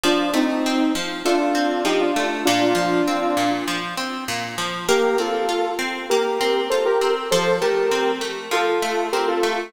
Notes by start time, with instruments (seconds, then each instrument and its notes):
0.04 acoustic guitar (steel) F3, lead 2 (sawtooth) D4 F4
0.34 acoustic guitar (steel) A3, lead 2 (sawtooth) C4 D#4
0.66 acoustic guitar (steel) C4
0.95 acoustic guitar (steel) F3
1.25 acoustic guitar (steel) A3, lead 2 (sawtooth) D4 F4
1.55 acoustic guitar (steel) C4
1.85 acoustic guitar (steel) F3, lead 2 (sawtooth) D#4 G4
2.01 lead 2 (sawtooth) D4 F4
2.16 acoustic guitar (steel) A3
2.45 acoustic guitar (steel) A#2, lead 2 (sawtooth) D4 F4
2.75 acoustic guitar (steel) F3
3.08 acoustic guitar (steel) C4
3.37 acoustic guitar (steel) A#2
3.68 acoustic guitar (steel) F3
3.97 acoustic guitar (steel) C4
4.28 acoustic guitar (steel) A#2
4.58 acoustic guitar (steel) F3
4.89 acoustic guitar (steel) A#3, lead 2 (sawtooth) G4 A#4
5.18 acoustic guitar (steel) C4, lead 2 (sawtooth) F4 A4
5.49 acoustic guitar (steel) F4
5.79 acoustic guitar (steel) C4
6.10 acoustic guitar (steel) A#3, lead 2 (sawtooth) G4 A#4
6.41 acoustic guitar (steel) C4
6.70 acoustic guitar (steel) F4, lead 2 (sawtooth) A4 C5
6.85 lead 2 (sawtooth) G4 A#4
7.01 acoustic guitar (steel) C4
7.31 acoustic guitar (steel) F3, lead 2 (sawtooth) A4 C5
7.61 acoustic guitar (steel) A3, lead 2 (sawtooth) G4 A#4
7.91 acoustic guitar (steel) C4
8.21 acoustic guitar (steel) A3
8.51 acoustic guitar (steel) F3, lead 2 (sawtooth) F4 A4
8.82 acoustic guitar (steel) A3
9.13 acoustic guitar (steel) C4, lead 2 (sawtooth) G4 A#4
9.28 lead 2 (sawtooth) F4 A4
9.43 acoustic guitar (steel) A3